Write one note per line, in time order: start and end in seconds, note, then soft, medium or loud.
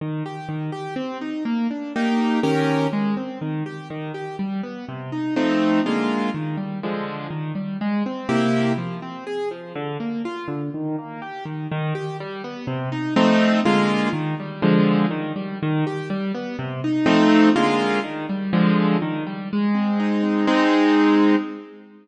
0.01 0.23 D#3 medium
0.26 0.48 G4 medium
0.49 0.71 D#3 medium
0.72 0.94 G4 medium
0.96 1.18 C4 medium
1.21 1.43 D#4 medium
1.45 1.67 A#3 medium
1.71 1.93 D4 medium
1.96 2.40 A#3 medium
1.96 2.40 D#4 medium
1.96 2.40 G4 medium
2.43 2.87 D#3 medium
2.43 2.87 C#4 medium
2.43 2.87 G4 medium
2.43 2.87 A#4 medium
2.93 3.15 G#3 medium
3.17 3.39 C4 medium
3.41 3.63 D#3 medium
3.66 3.88 G4 medium
3.90 4.12 D#3 medium
4.14 4.36 G4 medium
4.39 4.61 G3 medium
4.63 4.85 B3 medium
4.89 5.10 C3 medium
5.12 5.34 D#4 medium
5.36 5.80 F3 medium
5.36 5.80 A3 medium
5.36 5.80 C4 medium
5.36 5.80 D#4 medium
5.86 6.30 D3 medium
5.86 6.30 G#3 medium
5.86 6.30 A#3 medium
5.86 6.30 F4 medium
6.34 6.56 D#3 medium
6.57 6.79 G3 medium
6.83 7.27 D3 medium
6.83 7.27 F3 medium
6.83 7.27 G#3 medium
7.30 7.52 D#3 medium
7.55 7.77 G3 medium
7.81 8.03 G#3 medium
8.06 8.28 C4 medium
8.29 8.73 C3 medium
8.29 8.73 A#3 medium
8.29 8.73 E4 medium
8.29 8.73 G4 medium
8.78 9.00 F3 medium
9.02 9.24 C4 medium
9.27 9.49 G#4 medium
9.51 9.73 F3 medium
9.75 9.97 D3 loud
10.00 10.22 A#3 medium
10.25 10.47 F4 medium
10.48 10.70 D3 medium
10.74 10.96 D#3 medium
10.98 11.20 A#3 medium
11.22 11.44 G4 medium
11.45 11.67 D#3 medium
11.72 11.93 D#3 loud
11.95 12.17 G4 medium
12.20 12.42 G3 medium
12.44 12.66 B3 medium
12.67 12.89 C3 medium
12.92 13.14 D#4 medium
13.16 13.60 F3 loud
13.16 13.60 A3 loud
13.16 13.60 C4 loud
13.16 13.60 D#4 loud
13.65 14.09 D3 medium
13.65 14.09 G#3 loud
13.65 14.09 A#3 medium
13.65 14.09 F4 loud
14.13 14.35 D#3 medium
14.40 14.62 G3 medium
14.62 15.06 D3 loud
14.62 15.06 F3 loud
14.62 15.06 G#3 medium
15.11 15.33 D#3 medium
15.36 15.58 G3 medium
15.63 15.85 D#3 loud
15.87 16.09 G4 medium
16.10 16.32 G3 medium
16.34 16.56 B3 medium
16.59 16.81 C3 loud
16.84 17.05 D#4 medium
17.06 17.50 F3 loud
17.06 17.50 A3 loud
17.06 17.50 C4 loud
17.06 17.50 D#4 loud
17.56 18.00 D3 medium
17.56 18.00 G#3 loud
17.56 18.00 A#3 medium
17.56 18.00 F4 loud
18.04 18.26 D#3 medium
18.29 18.51 G3 medium
18.53 18.97 D3 loud
18.53 18.97 F3 loud
18.53 18.97 G#3 medium
19.02 19.24 D#3 medium
19.27 19.49 G3 medium
19.53 20.46 G#3 medium
19.75 20.23 C4 medium
20.00 20.46 D#4 medium
20.23 20.46 C4 medium
20.47 21.36 G#3 loud
20.47 21.36 C4 loud
20.47 21.36 D#4 loud